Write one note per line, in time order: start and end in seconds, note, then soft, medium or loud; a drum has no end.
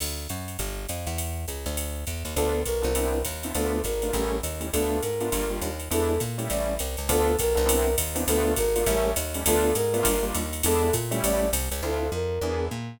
0.00 0.28 D2 medium
0.00 crash medium
0.00 ride loud
0.29 0.57 F#2 medium
0.29 hi-hat pedal medium
0.29 ride medium
0.48 ride medium
0.59 0.86 G1 medium
0.59 kick medium
0.59 ride medium
0.89 1.07 F2 medium
0.89 hi-hat pedal medium
0.89 ride medium
1.07 1.46 E2 medium
1.07 ride medium
1.18 ride medium
1.48 1.65 C#2 medium
1.48 hi-hat pedal medium
1.48 ride medium
1.66 2.05 D2 medium
1.66 ride medium
1.77 ride loud
2.07 2.23 E2 medium
2.07 kick medium
2.07 hi-hat pedal medium
2.07 ride medium
2.25 2.35 D#2 medium
2.25 ride medium
2.36 2.64 D2 loud
2.36 2.60 B3 medium
2.36 2.60 D4 medium
2.36 2.60 F4 medium
2.36 2.62 A4 loud
2.36 2.60 A4 medium
2.36 kick medium
2.36 ride medium
2.65 2.84 B1 medium
2.65 3.21 A#4 loud
2.65 kick medium
2.65 hi-hat pedal medium
2.65 ride medium
2.82 3.23 C2 medium
2.82 2.90 B3 medium
2.82 2.90 D4 medium
2.82 2.90 F4 medium
2.82 2.90 A4 medium
2.82 ride medium
2.95 3.18 B3 medium
2.95 3.18 C4 medium
2.95 3.18 D4 medium
2.95 3.18 E4 medium
2.95 ride loud
3.25 3.53 D#2 medium
3.25 kick medium
3.25 hi-hat pedal medium
3.25 ride loud
3.43 3.52 B3 medium
3.43 3.52 C4 medium
3.43 3.52 D4 medium
3.43 3.52 E4 medium
3.43 ride medium
3.55 3.82 D2 medium
3.55 3.78 A3 medium
3.55 3.78 B3 medium
3.55 3.78 D4 medium
3.55 3.78 F4 medium
3.55 3.82 A4 loud
3.55 ride loud
3.84 4.12 G#1 medium
3.84 4.37 A#4 loud
3.84 kick medium
3.84 hi-hat pedal medium
3.84 ride medium
4.02 4.11 A3 medium
4.02 4.11 B3 medium
4.02 4.11 D4 medium
4.02 4.11 F4 medium
4.02 ride medium
4.13 4.41 A1 medium
4.13 4.36 G3 medium
4.13 4.36 A3 medium
4.13 4.36 C#4 medium
4.13 4.36 E4 medium
4.13 kick medium
4.13 ride medium
4.43 4.71 D#2 medium
4.43 hi-hat pedal medium
4.43 ride medium
4.60 4.68 G3 medium
4.60 4.68 A3 medium
4.60 4.68 C#4 medium
4.60 4.68 E4 medium
4.60 ride medium
4.73 5.01 D2 medium
4.73 4.97 A3 medium
4.73 4.97 B3 medium
4.73 4.97 D4 medium
4.73 4.97 F4 medium
4.73 5.01 A4 loud
4.73 kick medium
4.73 ride loud
5.01 5.30 G#2 medium
5.01 5.51 A#4 loud
5.01 hi-hat pedal medium
5.01 ride medium
5.21 5.29 A3 medium
5.21 5.29 B3 medium
5.21 5.29 D4 medium
5.21 5.29 F4 medium
5.21 ride medium
5.32 5.60 G1 medium
5.32 5.45 G3 medium
5.32 5.45 A#3 medium
5.32 5.45 D4 medium
5.32 5.45 F4 loud
5.32 kick medium
5.32 ride loud
5.50 5.69 G3 medium
5.50 5.69 A#3 medium
5.50 5.69 D4 medium
5.50 5.69 F4 medium
5.61 5.89 D#2 medium
5.61 hi-hat pedal medium
5.61 ride medium
5.80 ride medium
5.91 6.19 E2 medium
5.91 6.13 G#3 medium
5.91 6.13 B3 medium
5.91 6.13 D4 loud
5.91 6.13 E4 loud
5.91 6.21 A4 loud
5.91 ride loud
6.20 6.48 A#2 medium
6.20 kick medium
6.20 hi-hat pedal medium
6.20 ride medium
6.38 6.72 G3 medium
6.38 6.72 A3 medium
6.38 6.72 C#4 medium
6.38 6.72 E4 medium
6.38 ride medium
6.49 6.78 A1 medium
6.49 6.75 D5 loud
6.49 ride loud
6.79 6.96 C2 medium
6.79 hi-hat pedal medium
6.79 ride medium
6.97 7.09 C#2 medium
6.97 ride medium
7.09 7.36 D2 loud
7.09 7.32 B3 loud
7.09 7.32 D4 loud
7.09 7.32 F4 medium
7.09 7.32 A4 loud
7.09 7.36 A4 loud
7.09 kick medium
7.09 ride loud
7.39 7.57 B1 medium
7.39 7.95 A#4 loud
7.39 kick medium
7.39 hi-hat pedal loud
7.39 ride loud
7.55 7.96 C2 loud
7.55 7.63 B3 medium
7.55 7.63 D4 medium
7.55 7.63 F4 medium
7.55 7.63 A4 medium
7.55 ride medium
7.66 7.89 B3 loud
7.66 7.89 C4 loud
7.66 7.89 D4 loud
7.66 7.89 E4 loud
7.66 ride loud
7.98 8.25 D#2 medium
7.98 kick medium
7.98 hi-hat pedal medium
7.98 ride loud
8.15 8.23 B3 loud
8.15 8.23 C4 medium
8.15 8.23 D4 medium
8.15 8.23 E4 medium
8.15 ride loud
8.28 8.55 D2 loud
8.28 8.52 A3 loud
8.28 8.52 B3 loud
8.28 8.52 D4 loud
8.28 8.52 F4 loud
8.28 8.53 A4 loud
8.28 ride loud
8.56 8.85 G#1 medium
8.56 9.10 A#4 loud
8.56 kick medium
8.56 hi-hat pedal medium
8.56 ride loud
8.76 8.84 A3 medium
8.76 8.84 B3 medium
8.76 8.84 D4 medium
8.76 8.84 F4 medium
8.76 ride medium
8.86 9.14 A1 loud
8.86 9.09 G3 loud
8.86 9.09 A3 loud
8.86 9.09 C#4 loud
8.86 9.09 E4 loud
8.86 kick medium
8.86 ride loud
9.16 9.44 D#2 medium
9.16 hi-hat pedal loud
9.16 ride loud
9.34 9.43 G3 medium
9.34 9.43 A3 medium
9.34 9.43 C#4 medium
9.34 9.43 E4 medium
9.34 ride medium
9.46 9.73 D2 loud
9.46 9.70 A3 loud
9.46 9.70 B3 loud
9.46 9.70 D4 loud
9.46 9.70 F4 loud
9.46 9.75 A4 loud
9.46 kick medium
9.46 ride loud
9.75 10.03 G#2 medium
9.75 10.25 A#4 loud
9.75 hi-hat pedal medium
9.75 ride medium
9.93 10.02 A3 medium
9.93 10.02 B3 loud
9.93 10.02 D4 loud
9.93 10.02 F4 medium
9.93 ride medium
10.03 10.32 G1 medium
10.03 10.16 G3 loud
10.03 10.16 A#3 loud
10.03 10.16 D4 loud
10.03 10.16 F4 loud
10.03 kick medium
10.03 ride loud
10.23 10.42 G3 medium
10.23 10.42 A#3 medium
10.23 10.42 D4 medium
10.23 10.42 F4 medium
10.34 10.62 D#2 medium
10.34 hi-hat pedal loud
10.34 ride loud
10.53 ride medium
10.63 10.91 E2 loud
10.63 10.88 G#3 loud
10.63 10.88 B3 medium
10.63 10.88 D4 loud
10.63 10.88 E4 loud
10.63 10.94 A4 loud
10.63 ride loud
10.93 11.21 A#2 medium
10.93 kick medium
10.93 hi-hat pedal loud
10.93 ride loud
11.11 11.45 G3 loud
11.11 11.45 A3 loud
11.11 11.45 C#4 medium
11.11 11.45 E4 loud
11.11 ride medium
11.23 11.51 A1 medium
11.23 11.50 D5 loud
11.23 ride loud
11.53 11.69 C2 loud
11.53 hi-hat pedal medium
11.53 ride loud
11.71 11.82 C#2 medium
11.71 ride medium
11.82 12.10 D2 medium
11.82 12.05 C4 medium
11.82 12.05 D4 medium
11.82 12.05 E4 medium
11.82 12.05 F4 medium
11.82 12.11 A4 loud
12.12 12.39 F2 medium
12.12 12.65 A#4 loud
12.41 12.69 E2 medium
12.41 12.66 B3 medium
12.41 12.66 D4 medium
12.41 12.66 E4 medium
12.41 12.66 G#4 medium
12.71 12.98 A#2 medium